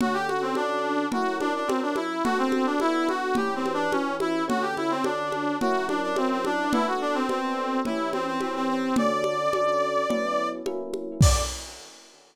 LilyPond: <<
  \new Staff \with { instrumentName = "Brass Section" } { \time 4/4 \key d \mixolydian \tempo 4 = 107 fis'16 g'16 fis'16 c'16 d'4 fis'8 d'16 d'16 c'16 d'16 e'8 | fis'16 c'8 d'16 e'8 fis'8 \tuplet 3/2 { g'8 c'8 d'8 } cis'8 e'8 | fis'16 g'16 e'16 c'16 d'4 fis'8 d'16 d'16 c'16 c'16 d'8 | e'16 fis'16 d'16 c'16 c'4 e'8 c'16 c'16 c'16 c'16 c'8 |
d''2. r4 | d''4 r2. | }
  \new Staff \with { instrumentName = "Electric Piano 1" } { \time 4/4 \key d \mixolydian <d cis' fis' a'>4 <d cis' fis' a'>4 <fis cis' e' ais'>4 <fis cis' e' ais'>4 | <b d' fis' a'>4 <b d' fis' a'>4 <e cis' g' b'>4 <e cis' g' b'>4 | <d cis' fis' a'>4 <d cis' fis' a'>4 <fis cis' e' ais'>4 <fis cis' e' ais'>4 | <b d' fis' a'>4 <b d' fis' a'>4 <e cis' g' b'>4 <e cis' g' b'>4 |
<d cis' fis' a'>4 <d cis' fis' a'>4 <fis b cis' e'>4 <fis ais cis' e'>4 | <d cis' fis' a'>4 r2. | }
  \new DrumStaff \with { instrumentName = "Drums" } \drummode { \time 4/4 cgl8 cgho8 cgho4 cgl8 cgho8 cgho8 cgho8 | cgl8 cgho8 cgho8 cgho8 cgl8 cgho8 cgho8 cgho8 | cgl8 cgho8 cgho8 cgho8 cgl8 cgho8 cgho8 cgho8 | cgl4 cgho4 cgl8 cgho8 cgho4 |
cgl8 cgho8 cgho4 cgl4 cgho8 cgho8 | <cymc bd>4 r4 r4 r4 | }
>>